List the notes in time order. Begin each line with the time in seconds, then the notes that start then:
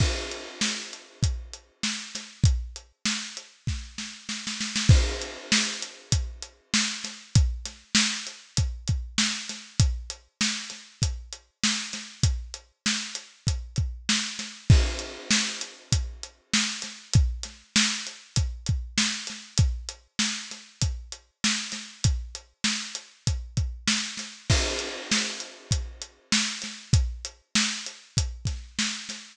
0.00 kick, crash
0.32 closed hi-hat
0.61 snare
0.93 closed hi-hat
1.23 kick, closed hi-hat
1.53 closed hi-hat
1.83 snare
2.15 snare, closed hi-hat
2.44 kick, closed hi-hat
2.76 closed hi-hat
3.05 snare
3.37 closed hi-hat
3.67 kick, snare
3.98 snare
4.29 snare
4.47 snare
4.60 snare
4.76 snare
4.89 kick, crash
5.22 closed hi-hat
5.52 snare
5.82 closed hi-hat
6.12 kick, closed hi-hat
6.42 closed hi-hat
6.74 snare
7.04 snare, closed hi-hat
7.35 kick, closed hi-hat
7.65 snare, closed hi-hat
7.95 snare
8.27 closed hi-hat
8.57 kick, closed hi-hat
8.88 kick, closed hi-hat
9.18 snare
9.49 snare, closed hi-hat
9.80 kick, closed hi-hat
10.10 closed hi-hat
10.41 snare
10.70 snare, closed hi-hat
11.02 kick, closed hi-hat
11.33 closed hi-hat
11.64 snare
11.93 snare, closed hi-hat
12.23 kick, closed hi-hat
12.54 closed hi-hat
12.86 snare
13.15 closed hi-hat
13.47 kick, closed hi-hat
13.76 kick, closed hi-hat
14.09 snare
14.39 snare, closed hi-hat
14.70 kick, crash
14.99 closed hi-hat
15.31 snare
15.61 closed hi-hat
15.92 kick, closed hi-hat
16.23 closed hi-hat
16.54 snare
16.82 snare, closed hi-hat
17.14 kick, closed hi-hat
17.43 snare, closed hi-hat
17.76 snare
18.07 closed hi-hat
18.36 kick, closed hi-hat
18.66 kick, closed hi-hat
18.98 snare
19.27 snare, closed hi-hat
19.58 kick, closed hi-hat
19.89 closed hi-hat
20.19 snare
20.51 snare, closed hi-hat
20.82 kick, closed hi-hat
21.12 closed hi-hat
21.44 snare
21.72 snare, closed hi-hat
22.04 kick, closed hi-hat
22.35 closed hi-hat
22.64 snare
22.95 closed hi-hat
23.27 kick, closed hi-hat
23.57 kick, closed hi-hat
23.88 snare
24.17 snare, closed hi-hat
24.50 kick, crash
24.79 closed hi-hat
25.11 snare
25.40 closed hi-hat
25.71 kick, closed hi-hat
26.02 closed hi-hat
26.32 snare
26.62 snare, closed hi-hat
26.93 kick, closed hi-hat
27.25 closed hi-hat
27.55 snare
27.86 closed hi-hat
28.17 kick, closed hi-hat
28.45 kick, snare, closed hi-hat
28.79 snare
29.09 snare, closed hi-hat